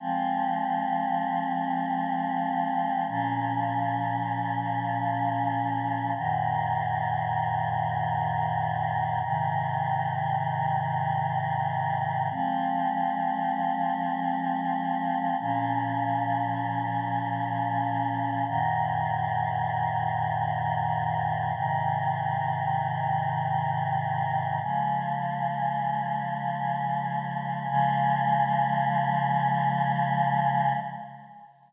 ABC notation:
X:1
M:4/4
L:1/8
Q:1/4=78
K:Db
V:1 name="Choir Aahs"
[F,A,C]8 | [B,,F,D]8 | [G,,B,,E,]8 | [A,,C,E,]8 |
[F,A,C]8 | [B,,F,D]8 | [G,,B,,E,]8 | [A,,C,E,]8 |
[D,F,A,]8 | [D,F,A,]8 |]